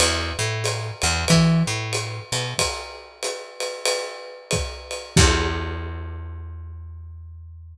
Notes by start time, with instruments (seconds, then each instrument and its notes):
0.00 electric bass (finger) E2, ride
0.39 electric bass (finger) A2
0.64 hi-hat pedal, ride
1.02 electric bass (finger) E2, ride
1.28 electric bass (finger) E3, kick, ride
1.67 electric bass (finger) A2
1.93 hi-hat pedal, ride
2.32 electric bass (finger) B2, ride
2.58 kick, ride
3.23 hi-hat pedal, ride
3.60 ride
3.85 ride
4.51 kick, hi-hat pedal, ride
4.91 ride
5.17 electric bass (finger) E2, kick, crash